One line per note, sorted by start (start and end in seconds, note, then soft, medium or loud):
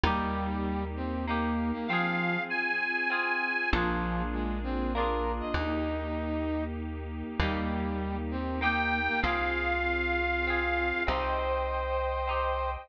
0.04 1.72 D#2 medium
0.04 0.84 G3 loud
0.04 1.16 A#3 loud
0.04 1.86 A#3 medium
0.04 1.86 D#4 medium
0.04 1.16 D#4 loud
0.04 1.86 G4 medium
0.04 1.16 G4 loud
0.96 1.25 C4 medium
1.27 1.71 A#3 medium
1.27 1.84 A#3 medium
1.27 1.84 D#4 medium
1.27 1.84 G4 medium
1.73 1.87 A#3 medium
1.88 2.37 F3 loud
1.88 3.70 C4 medium
1.88 3.03 C4 loud
1.88 3.70 F4 medium
1.88 3.03 F4 loud
1.88 3.70 G#4 medium
1.88 2.43 F5 medium
1.93 3.03 G#4 loud
2.50 3.71 G#5 medium
3.10 3.66 C4 medium
3.10 3.66 F4 medium
3.10 3.66 G#4 medium
3.71 5.42 A#1 medium
3.71 4.22 F3 loud
3.71 5.53 A#3 medium
3.71 4.85 A#3 medium
3.71 5.53 D4 medium
3.71 4.85 D4 medium
3.71 5.53 F4 medium
3.71 5.53 G#4 medium
3.76 4.85 F4 loud
3.76 4.85 G#4 medium
4.33 4.59 G#3 medium
4.64 4.93 C4 medium
4.94 5.51 A#3 medium
4.94 5.51 D4 medium
4.94 5.51 F4 medium
4.94 5.32 A#4 medium
4.99 5.51 G#4 medium
5.40 5.55 D#5 medium
5.54 7.23 D#2 medium
5.54 7.37 A#3 medium
5.54 7.37 D#4 medium
5.54 6.64 D#4 loud
5.54 7.37 G4 medium
7.39 9.09 D#2 medium
7.39 8.17 G3 loud
7.39 8.52 A#3 loud
7.39 9.22 A#3 medium
7.39 9.22 D#4 medium
7.39 8.52 D#4 medium
7.39 9.22 G4 medium
7.39 8.52 G4 loud
8.31 8.60 C4 medium
8.61 9.17 A#3 medium
8.61 9.00 A#3 medium
8.61 9.17 D#4 medium
8.61 9.17 G4 medium
8.61 9.20 G5 medium
9.07 9.22 A#3 medium
9.22 10.93 C2 medium
9.22 11.04 C4 medium
9.22 10.36 C4 medium
9.22 11.04 F4 medium
9.22 11.02 F4 loud
9.22 10.36 F4 medium
9.22 11.04 G#4 medium
9.22 10.36 G#4 loud
9.22 11.04 F5 medium
10.47 11.03 C4 medium
10.47 11.03 F4 medium
10.47 11.03 G#4 medium
11.06 12.77 C2 medium
11.06 12.20 C4 loud
11.06 12.20 D#4 loud
11.06 12.20 G4 medium
11.06 12.88 C5 medium
11.06 12.71 C5 loud
11.06 12.88 D#5 medium
11.06 12.88 G5 medium
12.27 12.84 C4 medium
12.27 12.84 D#4 medium
12.27 12.84 G4 medium